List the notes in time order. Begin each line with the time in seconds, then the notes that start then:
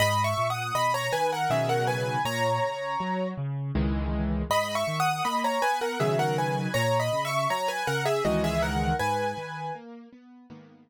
0.00 G#2 D#5 B5
0.24 E5 C#6
0.38 A#2
0.50 F#5 D#6
0.75 B2 D#5 B5
0.94 C#5 A#5
1.12 D#3 B4 G#5
1.32 A#4 F#5
1.50 B2 C#3 D#3 F#3 G#4 E5
1.69 A#4 F#5
1.87 B4 G#5
2.25 A#2 C#5 A#5
2.62 C#3
3.00 F#3
3.38 C#3
3.75 C#2 D#3 E3 G#3
4.50 G#2 D#5 B5
4.75 E5 C#6
4.87 D#3
5.00 F#5 D#6
5.25 A#3 D#5 B5
5.44 C#5 A#5
5.62 B3 B4 G#5
5.81 A#4 F#5
6.00 B2 C#3 D#3 F#3 G#4 E5
6.19 A#4 F#5
6.38 B4 G#5
6.74 A#2 C#5 A#5
7.00 D#5 B5
7.13 C#3
7.25 E5 C#6
7.50 F#3 C#5 A#5
7.68 B4 G#5
7.87 C#3 A#4 F#5
8.05 G#4 E5
8.25 C#2 D#3 E3 G#3 F#4 D#5
8.44 G#4 E5
8.62 A#4 F#5
8.99 G#2 B4 G#5
9.38 D#3
9.75 A#3
10.12 B3
10.50 G#2 D#3 A#3 B3